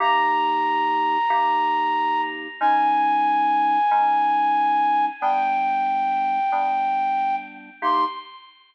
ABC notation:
X:1
M:4/4
L:1/8
Q:1/4=92
K:Cm
V:1 name="Flute"
b8 | a8 | g7 z | c'2 z6 |]
V:2 name="Electric Piano 2"
[C,B,EG]4 [C,B,EG]4 | [A,_DE]4 [A,DE]4 | [G,=B,D]4 [G,B,D]4 | [C,B,EG]2 z6 |]